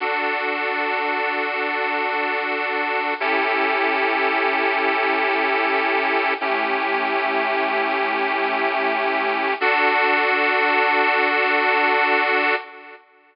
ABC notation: X:1
M:4/4
L:1/8
Q:1/4=75
K:D
V:1 name="Accordion"
[DFA]8 | [CEGA]8 | [A,CEG]8 | [DFA]8 |]